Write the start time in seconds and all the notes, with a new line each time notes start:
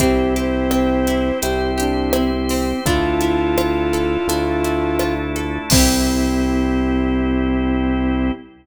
0.00 C2 C4 E4 G4, kick, closed hi-hat
0.36 G4 C5, closed hi-hat
0.71 C4, cross-stick
1.07 E4, closed hi-hat
1.42 C2 C4 E4 G4 C5, closed hi-hat
1.78 D4 G4, closed hi-hat
2.13 C4 E4, cross-stick
2.33 C4
2.49 C4, open hi-hat
2.86 D2 D4 E4 F4 A4, kick, closed hi-hat
3.21 E4, closed hi-hat
3.58 F4, cross-stick
3.93 A4, closed hi-hat
4.27 D2 A3 D4 E4 F4 A4, closed hi-hat
4.64 E4, closed hi-hat
4.99 F4, cross-stick
5.36 A4, closed hi-hat
5.70 C2 C4 E4 G4, kick, crash
5.76 G4